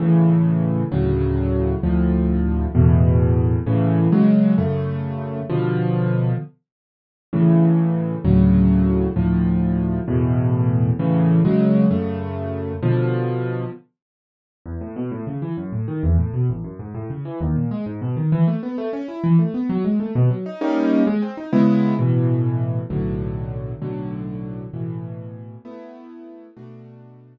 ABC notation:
X:1
M:6/8
L:1/8
Q:3/8=131
K:A
V:1 name="Acoustic Grand Piano"
[A,,C,E,]6 | [D,,A,,C,F,]6 | [D,,A,,=F,]6 | [E,,A,,B,,]6 |
[A,,C,E,]3 [C,F,G,]3 | [F,,C,A,]6 | [B,,D,=F,]6 | z6 |
[A,,C,E,]6 | [D,,A,,C,F,]6 | [D,,A,,=F,]6 | [E,,A,,B,,]6 |
[A,,C,E,]3 [C,F,G,]3 | [F,,C,A,]6 | [B,,D,=F,]6 | z6 |
[K:E] E,, A,, B,, A,, C, E, | F,, A,, D, E,, A,, B,, | A,,, F,, G,, A,, C, E, | D,, ^A,, G, G,, B,, D, |
E, A, B, A, C E | E, A, B, F, G, A, | B,, F, D [=G,^A,CD]3 | G, ^B, D [C,G,=B,E]3 |
[K:A] [A,,B,,E,]6 | [B,,,A,,D,F,]6 | [B,,,A,,D,F,]6 | [A,,B,,E,]6 |
[A,B,E]6 | [B,,A,DF]6 |]